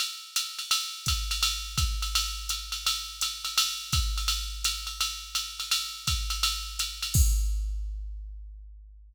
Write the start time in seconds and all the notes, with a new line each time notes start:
0.00 ride
0.36 hi-hat pedal, ride
0.59 ride
0.71 ride
1.06 kick, hi-hat pedal, ride
1.31 ride
1.43 ride
1.78 kick, hi-hat pedal, ride
2.02 ride
2.15 ride
2.49 hi-hat pedal, ride
2.72 ride
2.86 ride
3.21 hi-hat pedal, ride
3.45 ride
3.58 ride
3.92 kick, hi-hat pedal, ride
4.17 ride
4.28 ride
4.64 hi-hat pedal, ride
4.87 ride
5.01 ride
5.35 hi-hat pedal, ride
5.60 ride
5.71 ride
6.07 kick, hi-hat pedal, ride
6.30 ride
6.43 ride
6.79 hi-hat pedal, ride
7.02 ride
7.14 kick, crash